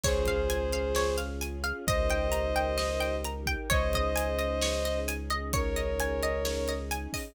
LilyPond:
<<
  \new Staff \with { instrumentName = "Violin" } { \time 4/4 \key des \major \tempo 4 = 131 <aes' c''>2. r4 | <c'' ees''>2. r4 | <c'' ees''>2. r4 | <bes' des''>2. r4 | }
  \new Staff \with { instrumentName = "Pizzicato Strings" } { \time 4/4 \key des \major des''8 f''8 aes''8 f''8 des''8 f''8 aes''8 f''8 | ees''8 g''8 bes''8 g''8 ees''8 g''8 bes''8 g''8 | des''8 ees''8 aes''8 ees''8 des''8 ees''8 aes''8 ees''8 | des''8 ees''8 aes''8 ees''8 des''8 ees''8 aes''8 ees''8 | }
  \new Staff \with { instrumentName = "Synth Bass 2" } { \clef bass \time 4/4 \key des \major des,1 | des,1 | des,1~ | des,1 | }
  \new Staff \with { instrumentName = "String Ensemble 1" } { \time 4/4 \key des \major <des' f' aes'>1 | <ees' g' bes'>1 | <des' ees' aes'>1~ | <des' ees' aes'>1 | }
  \new DrumStaff \with { instrumentName = "Drums" } \drummode { \time 4/4 <cymc bd>8 <hh bd>8 hh8 hh8 sn8 hh8 hh8 hh8 | <hh bd>8 hh8 hh8 hh8 sn8 hh8 hh8 <hh bd>8 | <hh bd>8 <hh bd>8 hh8 hh8 sn8 hh8 hh8 hh8 | <hh bd>8 hh8 hh8 hh8 sn8 hh8 hh8 <hho bd>8 | }
>>